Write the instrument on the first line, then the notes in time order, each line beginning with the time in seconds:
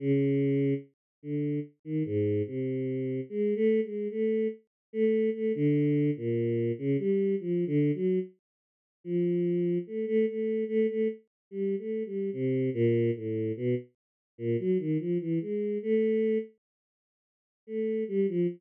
choir aahs
0.00 C#3
1.23 D3
1.85 D#3
2.05 G#2
2.47 C3
3.29 G#3
3.56 A3
3.83 G#3
4.10 A3
4.93 A3
5.34 A3
5.55 D3
6.16 A#2
6.78 C#3
6.98 G3
7.40 F3
7.67 D3
7.95 F#3
9.04 F3
9.87 A3
10.07 A3
10.27 A3
10.68 A3
10.89 A3
11.51 G3
11.79 A3
12.06 G3
12.33 C3
12.74 A#2
13.15 A2
13.57 B2
14.38 A#2
14.59 F#3
14.79 D#3
14.99 F3
15.20 E3
15.41 G#3
15.83 A3
17.67 A3
18.08 G3
18.28 F3